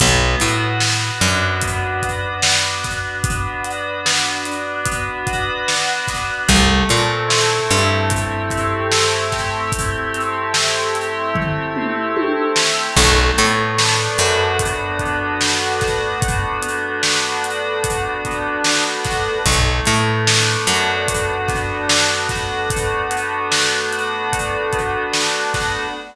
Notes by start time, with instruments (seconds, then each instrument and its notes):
0.00 electric bass (finger) B1, electric piano 2 B3, kick, closed hi-hat
0.40 electric bass (finger) A2, electric piano 2 F#4, closed hi-hat
0.80 electric piano 2 B3, snare
1.20 electric bass (finger) F#2, electric piano 2 D4, closed hi-hat
1.61 electric piano 2 B3, kick, closed hi-hat
2.03 electric piano 2 F#4, kick, closed hi-hat
2.42 electric piano 2 D4, snare
2.84 electric piano 2 B3, kick, snare, closed hi-hat
3.24 electric piano 2 B3, kick, closed hi-hat
3.65 electric piano 2 F#4, closed hi-hat
4.05 electric piano 2 B3, snare
4.45 electric piano 2 D4, closed hi-hat
4.85 electric piano 2 B3, kick, closed hi-hat
5.27 electric piano 2 F#4, kick, closed hi-hat
5.68 electric piano 2 D4, snare
6.08 electric piano 2 B3, kick, snare, closed hi-hat
6.48 electric bass (finger) C2, electric piano 2 A3, kick, closed hi-hat
6.89 electric bass (finger) A#2, electric piano 2 C4, closed hi-hat
7.28 electric piano 2 E4, snare
7.70 electric bass (finger) G2, electric piano 2 G4, closed hi-hat
8.10 electric piano 2 A3, kick, closed hi-hat
8.50 electric piano 2 C4, kick, closed hi-hat
8.92 electric piano 2 E4, snare
9.32 electric piano 2 G4, kick, snare, closed hi-hat
9.72 electric piano 2 A3, kick, closed hi-hat
10.14 electric piano 2 C4, closed hi-hat
10.54 electric piano 2 E4, snare
10.95 electric piano 2 G4, closed hi-hat
11.35 electric piano 2 A3, kick, floor tom
11.76 electric piano 2 C4, mid tom
12.16 electric piano 2 E4, high tom
12.56 electric piano 2 G4, snare
12.96 electric bass (finger) B1, electric piano 2 A3, kick, crash
13.38 electric bass (finger) A2, electric piano 2 B3, closed hi-hat
13.77 electric piano 2 D4, snare
14.18 electric bass (finger) F#2, electric piano 2 F#4, closed hi-hat
14.59 electric piano 2 A3, kick, closed hi-hat
14.99 electric piano 2 B3, kick, closed hi-hat
15.41 electric piano 2 D4, snare
15.80 electric piano 2 F#4, kick, snare, closed hi-hat
16.21 electric piano 2 A3, kick, closed hi-hat
16.61 electric piano 2 B3, closed hi-hat
17.02 electric piano 2 D4, snare
17.43 electric piano 2 F#4, closed hi-hat
17.83 electric piano 2 A3, kick, closed hi-hat
18.25 electric piano 2 B3, kick, closed hi-hat
18.64 electric piano 2 D4, snare
19.04 electric piano 2 F#4, kick, snare, closed hi-hat
19.45 electric bass (finger) B1, electric piano 2 A3, kick, closed hi-hat
19.85 electric bass (finger) A2, electric piano 2 B3, closed hi-hat
20.27 electric piano 2 D4, snare
20.67 electric bass (finger) F#2, electric piano 2 F#4, closed hi-hat
21.08 electric piano 2 A3, kick, closed hi-hat
21.48 electric piano 2 B3, kick, snare, closed hi-hat
21.88 electric piano 2 D4, snare
22.29 electric piano 2 F#4, kick, snare, closed hi-hat
22.70 electric piano 2 A3, kick, closed hi-hat
23.10 electric piano 2 B3, closed hi-hat
23.50 electric piano 2 D4, snare
23.92 electric piano 2 F#4, closed hi-hat
24.32 electric piano 2 A3, kick, closed hi-hat
24.73 electric piano 2 B3, kick, closed hi-hat
25.12 electric piano 2 D4, snare
25.54 electric piano 2 F#4, kick, snare, closed hi-hat